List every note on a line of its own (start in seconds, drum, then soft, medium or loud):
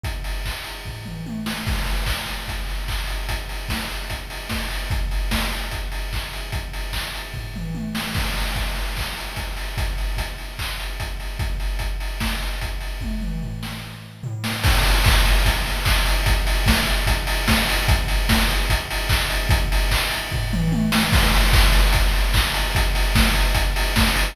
0.04 kick loud
0.04 closed hi-hat loud
0.24 open hi-hat medium
0.46 kick medium
0.46 clap loud
0.64 open hi-hat medium
0.85 kick medium
0.85 floor tom medium
1.05 mid tom medium
1.26 high tom medium
1.46 snare loud
1.67 kick loud
1.67 crash loud
1.86 open hi-hat medium
2.06 kick loud
2.06 clap loud
2.27 open hi-hat medium
2.48 kick medium
2.48 closed hi-hat loud
2.69 open hi-hat medium
2.88 kick medium
2.88 clap loud
3.07 open hi-hat medium
3.29 kick medium
3.29 closed hi-hat loud
3.49 open hi-hat medium
3.69 kick medium
3.69 snare loud
3.89 open hi-hat medium
4.10 kick medium
4.10 closed hi-hat loud
4.30 open hi-hat medium
4.49 kick medium
4.49 snare loud
4.70 open hi-hat medium
4.90 kick loud
4.90 closed hi-hat loud
5.11 open hi-hat medium
5.31 kick medium
5.31 snare loud
5.52 open hi-hat medium
5.71 kick medium
5.71 closed hi-hat loud
5.92 open hi-hat medium
6.13 kick medium
6.13 clap loud
6.33 open hi-hat medium
6.52 kick loud
6.52 closed hi-hat loud
6.73 open hi-hat medium
6.93 kick medium
6.93 clap loud
7.15 open hi-hat medium
7.34 kick medium
7.34 floor tom medium
7.56 mid tom medium
7.75 high tom medium
7.95 snare loud
8.14 kick loud
8.14 crash loud
8.37 open hi-hat medium
8.56 kick medium
8.56 closed hi-hat medium
8.76 open hi-hat medium
8.97 kick medium
8.97 clap loud
9.17 open hi-hat medium
9.36 kick medium
9.36 closed hi-hat loud
9.57 open hi-hat medium
9.77 kick loud
9.77 closed hi-hat loud
9.98 open hi-hat medium
10.17 kick medium
10.17 closed hi-hat loud
10.38 open hi-hat medium
10.59 kick medium
10.59 clap loud
10.79 open hi-hat medium
11.00 kick medium
11.00 closed hi-hat loud
11.20 open hi-hat medium
11.39 kick loud
11.39 closed hi-hat loud
11.60 open hi-hat medium
11.79 kick medium
11.79 closed hi-hat loud
12.00 open hi-hat medium
12.20 kick medium
12.20 snare loud
12.42 open hi-hat medium
12.61 kick medium
12.61 closed hi-hat loud
12.81 open hi-hat medium
13.01 kick medium
13.01 high tom medium
13.21 mid tom medium
13.42 floor tom medium
13.63 snare medium
14.23 floor tom loud
14.44 snare loud
14.64 kick loud
14.64 crash loud
14.84 open hi-hat loud
15.04 kick loud
15.04 clap loud
15.25 open hi-hat loud
15.45 kick loud
15.45 closed hi-hat loud
15.66 open hi-hat medium
15.85 kick loud
15.85 clap loud
16.06 open hi-hat loud
16.26 kick loud
16.26 closed hi-hat loud
16.47 open hi-hat loud
16.66 kick loud
16.66 snare loud
16.87 open hi-hat loud
17.07 kick loud
17.07 closed hi-hat loud
17.27 open hi-hat loud
17.48 kick loud
17.48 snare loud
17.69 open hi-hat loud
17.88 kick loud
17.88 closed hi-hat loud
18.08 open hi-hat loud
18.29 kick loud
18.29 snare loud
18.50 open hi-hat loud
18.70 kick loud
18.70 closed hi-hat loud
18.91 open hi-hat loud
19.09 kick loud
19.09 clap loud
19.30 open hi-hat loud
19.49 kick loud
19.49 closed hi-hat loud
19.72 open hi-hat loud
19.91 kick loud
19.91 clap loud
20.11 open hi-hat loud
20.32 kick loud
20.32 floor tom loud
20.53 mid tom loud
20.72 high tom loud
20.92 snare loud
21.12 kick loud
21.12 crash loud
21.34 open hi-hat loud
21.53 kick loud
21.53 clap loud
21.73 open hi-hat loud
21.93 kick loud
21.93 closed hi-hat loud
22.14 open hi-hat medium
22.34 kick loud
22.34 clap loud
22.54 open hi-hat loud
22.75 kick loud
22.75 closed hi-hat loud
22.95 open hi-hat loud
23.15 kick loud
23.15 snare loud
23.36 open hi-hat loud
23.55 kick loud
23.55 closed hi-hat loud
23.76 open hi-hat loud
23.96 kick loud
23.96 snare loud
24.16 open hi-hat loud